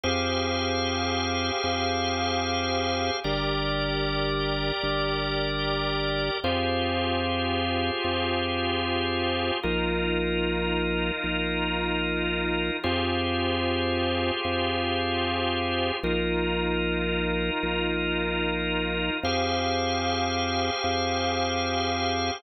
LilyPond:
<<
  \new Staff \with { instrumentName = "Drawbar Organ" } { \time 12/8 \key f \dorian \tempo 4. = 150 <g' aes' c'' f''>1.~ | <g' aes' c'' f''>1. | <g' bes' d''>1.~ | <g' bes' d''>1. |
<f' g' aes' c''>1.~ | <f' g' aes' c''>1. | <ees' f' bes'>1.~ | <ees' f' bes'>1. |
<f' g' aes' c''>1.~ | <f' g' aes' c''>1. | <ees' f' bes'>1.~ | <ees' f' bes'>1. |
<g' aes' c'' f''>1.~ | <g' aes' c'' f''>1. | }
  \new Staff \with { instrumentName = "Drawbar Organ" } { \clef bass \time 12/8 \key f \dorian f,1. | f,1. | g,,1. | g,,1. |
f,1. | f,1. | bes,,1. | bes,,1. |
f,1. | f,1. | bes,,1. | bes,,1. |
f,1. | f,1. | }
>>